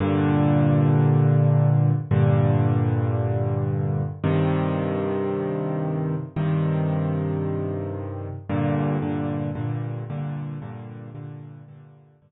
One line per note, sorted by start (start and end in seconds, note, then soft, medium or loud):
0.00 1.91 G2 loud
0.00 1.91 A#2 loud
0.00 1.91 D3 loud
2.11 4.02 G2 loud
2.11 4.02 A#2 medium
2.11 4.02 D3 loud
4.24 6.15 G2 loud
4.24 6.15 C3 loud
4.24 6.15 D#3 loud
6.36 8.28 G2 medium
6.36 8.28 C3 medium
6.36 8.28 D#3 medium
8.49 8.97 G2 loud
8.49 8.97 A#2 loud
8.49 8.97 D3 medium
9.02 9.50 G2 medium
9.02 9.50 A#2 medium
9.02 9.50 D3 medium
9.55 10.03 G2 medium
9.55 10.03 A#2 medium
9.55 10.03 D3 medium
10.10 10.58 G2 medium
10.10 10.58 A#2 loud
10.10 10.58 D3 loud
10.62 11.10 G2 loud
10.62 11.10 A#2 medium
10.62 11.10 D3 medium
11.15 11.62 G2 loud
11.15 11.62 A#2 medium
11.15 11.62 D3 loud
11.68 12.16 G2 loud
11.68 12.16 A#2 medium
11.68 12.16 D3 loud
12.22 12.31 G2 loud
12.22 12.31 A#2 medium
12.22 12.31 D3 loud